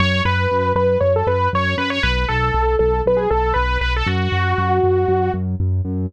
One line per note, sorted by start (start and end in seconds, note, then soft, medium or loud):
0.00 0.21 F#2 loud
0.00 0.22 C#5 loud
0.25 0.47 F#2 loud
0.25 0.72 B4 loud
0.51 0.73 F#2 medium
0.75 0.97 F#2 medium
0.75 0.98 B4 loud
1.00 1.23 F#2 loud
1.00 1.13 C#5 loud
1.16 1.28 A4 loud
1.27 1.48 F#2 medium
1.27 1.49 B4 loud
1.53 1.75 F#2 loud
1.53 1.76 C#5 loud
1.78 1.99 F#2 loud
1.78 1.90 B4 loud
1.90 2.02 C#5 loud
2.03 2.25 B1 loud
2.03 2.25 B4 loud
2.28 2.51 B1 loud
2.28 2.75 A4 loud
2.54 2.76 B1 medium
2.79 3.02 B1 loud
2.79 3.01 A4 loud
3.06 3.27 B1 medium
3.06 3.19 B4 loud
3.17 3.29 G#4 loud
3.30 3.53 B1 loud
3.30 3.52 A4 loud
3.54 3.78 B1 loud
3.54 3.78 B4 loud
3.81 4.03 B1 medium
3.81 3.93 B4 loud
3.96 4.08 A4 loud
4.06 4.28 F#2 loud
4.06 5.32 F#4 loud
4.32 4.54 F#2 medium
4.58 4.80 F#2 loud
4.83 5.05 F#2 loud
5.08 5.30 F#2 loud
5.34 5.55 F#2 loud
5.60 5.81 F#2 loud
5.85 6.06 F#2 medium